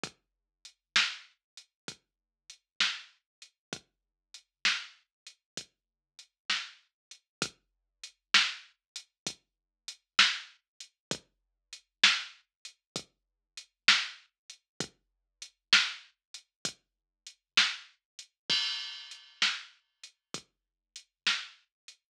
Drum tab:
CC |------------|------------|------------|------------|
HH |x-x--xx-x--x|x-x--xx-x--x|x-x--xx-x--x|x-x--xx-x--x|
SD |---o-----o--|---o-----o--|---o-----o--|---o-----o--|
BD |o-----o-----|o-----o-----|o-----o-----|o-----o-----|

CC |------------|x-----------|
HH |x-x--xx-x--x|--x--xx-x--x|
SD |---o-----o--|---o-----o--|
BD |o-----o-----|o-----o-----|